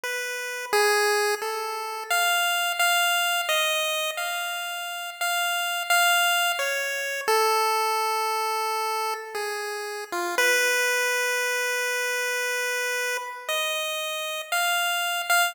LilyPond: \new Staff { \time 5/4 \tempo 4 = 58 \tuplet 3/2 { b'4 aes'4 a'4 f''4 f''4 ees''4 } f''4 | \tuplet 3/2 { f''4 f''4 des''4 } a'2 aes'8. f'16 | b'2. ees''4 f''8. f''16 | }